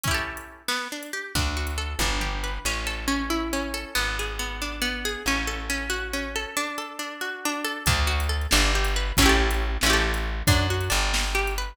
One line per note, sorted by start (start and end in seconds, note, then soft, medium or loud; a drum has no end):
0.04 0.63 C#4 medium
0.04 0.63 E4 medium
0.04 kick loud
0.04 closed hi-hat loud
0.11 0.63 G4 medium
0.11 0.63 A4 medium
0.37 closed hi-hat medium
0.68 0.88 B3 medium
0.68 snare loud
0.92 1.12 D4 medium
1.03 closed hi-hat medium
1.13 1.33 G4 medium
1.35 1.95 D2 medium
1.35 1.97 D4 medium
1.35 kick loud
1.35 closed hi-hat medium
1.57 1.98 F#4 medium
1.67 closed hi-hat medium
1.78 1.98 A4 medium
1.99 2.59 G1 loud
1.99 2.63 D4 medium
1.99 kick medium
1.99 high tom medium
2.20 2.62 G4 medium
2.20 floor tom medium
2.44 2.64 B4 medium
2.65 3.85 A1 medium
2.65 3.07 C#4 medium
2.87 3.73 A4 medium
3.08 3.52 C#4 medium
3.30 3.92 E4 medium
3.53 3.94 C#4 medium
3.74 3.94 A4 medium
3.95 5.16 G#1 medium
3.95 4.39 B3 medium
4.19 5.04 G#4 medium
4.39 4.81 B3 medium
4.62 5.24 D4 medium
4.82 5.23 B3 medium
5.05 5.26 G#4 medium
5.26 6.46 A1 medium
5.26 5.69 C#4 medium
5.47 6.35 A4 medium
5.70 6.13 C#4 medium
5.90 6.52 F#4 medium
6.13 6.55 C#4 medium
6.36 6.56 A4 medium
6.57 6.98 D4 medium
6.78 7.64 A4 medium
6.99 7.45 D4 medium
7.21 7.83 F#4 medium
7.45 7.86 D4 medium
7.64 7.85 A4 medium
7.86 8.47 D2 loud
7.86 8.06 D4 medium
7.86 kick loud
7.86 closed hi-hat loud
8.07 8.27 F#4 medium
8.20 closed hi-hat medium
8.29 8.49 A4 medium
8.41 closed hi-hat medium
8.51 9.12 G1 loud
8.51 8.72 D4 medium
8.51 snare loud
8.75 8.95 G4 medium
8.85 closed hi-hat medium
8.96 9.16 B4 medium
9.17 9.78 A1 loud
9.17 9.77 C#4 loud
9.17 kick loud
9.17 closed hi-hat loud
9.22 9.77 E4 medium
9.22 9.77 G4 medium
9.29 9.77 A4 medium
9.51 closed hi-hat medium
9.81 10.43 A1 loud
9.81 10.41 C#4 medium
9.81 snare loud
9.86 10.41 E4 medium
9.86 10.41 G4 medium
9.93 10.41 A4 medium
10.14 closed hi-hat medium
10.47 10.89 F#2 loud
10.47 10.67 D4 medium
10.47 kick loud
10.47 closed hi-hat loud
10.70 10.90 F#4 medium
10.81 closed hi-hat medium
10.90 11.73 G1 loud
10.90 11.31 D4 medium
11.14 snare loud
11.35 11.54 G4 medium
11.47 closed hi-hat medium
11.58 11.77 B4 medium